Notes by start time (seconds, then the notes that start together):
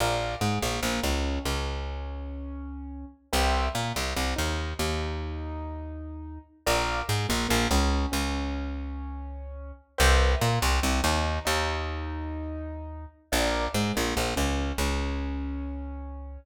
0.00 A#1 A#4 D5 F5
0.41 G#2 G#3
0.62 A#1 A#3
0.83 A#1 A#3
1.03 C#2 C#4
1.45 C#2 C#4
3.33 C2 B4 C5 E5 G5
3.75 A#2 A#3
3.96 C2 C4
4.16 C2 C4
4.36 D#2 D#4
4.79 D#2 D#4
6.66 A#1 A#4 D5 F5
7.08 G#2 G#3
7.29 A#1 A#3
7.49 A#1 A#3
7.71 C#2 C#4
8.12 C#2 C#4
9.98 C2 B4 C5 E5 G5
10.41 A#2 A#3
10.62 C2 C4
10.83 C2 C4
11.04 D#2 D#4
11.45 D#2 D#4
13.32 A#1 A#4 D5 F5
13.74 G#2 G#3
13.95 A#1 A#3
14.16 A#1 A#3
14.36 C#2 C#4
14.78 C#2 C#4